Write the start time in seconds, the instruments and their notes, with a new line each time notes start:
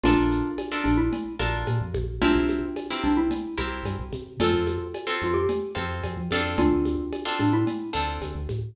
0.04 synth bass 1 A#1, xylophone D4 F4, acoustic guitar (steel) D4 F4 A4 A#4, cowbell, low conga, shaker
0.17 synth bass 1 A#1
0.31 shaker
0.58 cowbell, high conga, shaker
0.71 acoustic guitar (steel) D4 F4 A4 A#4
0.84 synth bass 1 A#1, xylophone D4, high conga, shaker
0.98 xylophone E4
1.13 cowbell, low conga, shaker
1.39 synth bass 1 A#1, acoustic guitar (steel) D4 F4 A4 A#4, high conga, shaker
1.67 synth bass 1 A#2, cowbell, high conga, shaker
1.81 synth bass 1 F2
1.94 synth bass 1 A#1, high conga, shaker
2.22 synth bass 1 C2, acoustic guitar (steel) C4 E4 G4 A#4, xylophone D4 F4, cowbell, low conga, shaker
2.35 synth bass 1 C2
2.49 high conga, shaker
2.76 cowbell, high conga, shaker
2.90 acoustic guitar (steel) C4 E4 G4 A#4
3.03 synth bass 1 C2, xylophone D4, shaker
3.17 xylophone E4
3.31 cowbell, low conga, shaker
3.58 synth bass 1 C2, acoustic guitar (steel) C4 E4 G4 A#4, high conga, shaker
3.85 synth bass 1 G2, cowbell, high conga, shaker
3.99 synth bass 1 C2
4.13 synth bass 1 C3, high conga, shaker
4.40 synth bass 1 F2, acoustic guitar (steel) C4 F4 A4, xylophone F4 A4, cowbell, low conga, shaker
4.54 synth bass 1 F2
4.67 high conga, shaker
4.94 cowbell, high conga, shaker
5.07 acoustic guitar (steel) C4 F4 A4
5.22 synth bass 1 F2, xylophone F4, shaker
5.34 xylophone G4
5.49 cowbell, low conga, shaker
5.75 synth bass 1 F2, acoustic guitar (steel) C4 F4 A4, high conga, shaker
6.04 synth bass 1 F2, cowbell, high conga, shaker
6.17 synth bass 1 F3
6.31 synth bass 1 F2, acoustic guitar (steel) C4 D4 F4 A4, high conga, shaker
6.58 synth bass 1 D2, xylophone D4 F4, cowbell, low conga, shaker
6.72 synth bass 1 D2
6.85 high conga, shaker
7.13 cowbell, high conga, shaker
7.25 acoustic guitar (steel) C4 D4 F4 A4
7.39 synth bass 1 A2, xylophone D4, high conga, shaker
7.53 xylophone E4
7.67 cowbell, low conga, shaker
7.93 synth bass 1 D2, acoustic guitar (steel) C4 D4 F4 A4, shaker
8.22 synth bass 1 D2, cowbell, high conga, shaker
8.35 synth bass 1 D2
8.49 synth bass 1 A2, high conga, shaker